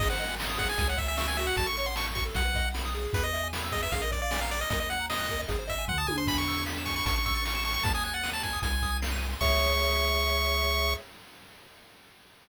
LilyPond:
<<
  \new Staff \with { instrumentName = "Lead 1 (square)" } { \time 4/4 \key cis \minor \tempo 4 = 153 dis''16 fis''8. r8 fis''16 gis''16 gis''16 fis''16 e''16 e''16 e''16 gis''16 e''16 fis''16 | a''16 cis'''16 cis'''16 bis''16 cis'''16 r16 cis'''16 r16 fis''4 r4 | b'16 dis''8. r8 dis''16 e''16 eis''16 dis''16 d''16 d''16 d''16 eis''16 d''16 dis''16 | dis''16 dis''16 fis''8 dis''4 r8 e''8 fis''16 a''16 gis''16 bis''16 |
b''16 cis'''8. r8 cis'''16 cis'''16 cis'''16 cis'''16 cis'''16 cis'''16 cis'''16 cis'''16 cis'''16 cis'''16 | a''16 gis''16 gis''16 fis''8 a''16 gis''8 gis''4 r4 | cis'''1 | }
  \new Staff \with { instrumentName = "Lead 1 (square)" } { \time 4/4 \key cis \minor gis'16 bis'16 dis''16 gis''16 bis''16 dis'''16 gis'8. cis''16 e''16 gis''16 cis'''16 e'''16 fis'8~ | fis'16 a'16 cis''16 fis''16 a''16 cis'''16 fis'16 a'16 fis'16 b'16 dis''16 fis''16 b''16 dis'''16 gis'8~ | gis'16 b'16 e''16 gis''16 b''16 e'''16 gis'16 b'16 gis'16 ais'16 d''16 eis''16 gis''16 ais''16 d'''16 eis'''16 | ais'16 dis''16 fis''16 ais''16 dis'''16 fis'''16 ais'16 dis''16 gis'16 bis'16 dis''16 gis''16 bis''16 dis'''16 gis'16 bis'16 |
gis''16 b''16 e'''16 gis'''16 b'''16 e''''16 gis''16 b''16 a''16 cis'''16 e'''16 a'''16 cis''''16 e''''16 a''16 cis'''16 | a''16 dis'''16 fis'''16 a'''16 dis''''16 fis''''16 a''16 dis'''16 gis''16 bis''16 dis'''16 gis'''16 bis'''16 dis''''16 gis''16 bis''16 | <gis' cis'' e''>1 | }
  \new Staff \with { instrumentName = "Synth Bass 1" } { \clef bass \time 4/4 \key cis \minor gis,,2 cis,2 | a,,2 b,,2 | e,2 ais,,2 | dis,2 gis,,4 d,8 dis,8 |
e,2 a,,2 | dis,2 bis,,2 | cis,1 | }
  \new DrumStaff \with { instrumentName = "Drums" } \drummode { \time 4/4 <cymc bd>8 hh8 sn8 <hh bd>8 <hh bd>8 <hh bd>8 sn8 hh8 | <hh bd>8 hh8 sn8 <hh bd>8 <hh bd>8 <hh bd>8 sn8 hh8 | <hh bd>8 hh8 sn8 <hh bd>8 <hh bd>8 <hh bd>8 sn8 hh8 | <hh bd>8 hh8 sn8 <hh bd>8 <hh bd>8 <hh bd>8 <bd tomfh>8 tommh8 |
<cymc bd>8 hh8 sn8 <hh bd>8 <hh bd>8 <hh bd>8 sn8 hho8 | <hh bd>8 hh8 sn8 <hh bd>8 <hh bd>8 <hh bd>8 sn8 hh8 | <cymc bd>4 r4 r4 r4 | }
>>